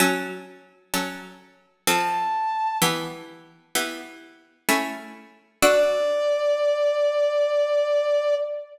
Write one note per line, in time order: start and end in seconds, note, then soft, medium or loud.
0.00 0.84 F#3 medium
0.00 0.84 C#4 loud
0.00 0.84 A4 loud
0.94 1.78 F#3 medium
0.94 1.78 C#4 medium
0.94 1.78 A4 medium
1.87 2.72 F3 medium
1.87 2.72 C4 loud
1.87 2.72 A4 loud
1.87 2.78 A5 medium
2.82 3.66 E3 loud
2.82 3.66 B3 medium
2.82 3.66 G4 medium
3.75 4.60 E3 medium
3.75 4.60 B3 medium
3.75 4.60 G4 medium
4.69 5.53 A3 medium
4.69 5.53 C#4 loud
4.69 5.53 E4 medium
5.62 8.35 D4 loud
5.62 8.35 F#4 loud
5.62 8.35 A4 loud
5.62 8.35 D5 loud